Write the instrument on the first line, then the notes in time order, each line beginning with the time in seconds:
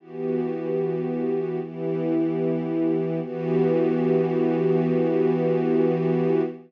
string ensemble 1
0.00 E3 B3 F#4 G4
1.61 E3 B3 E4 G4
3.21 E3 B3 F#4 G4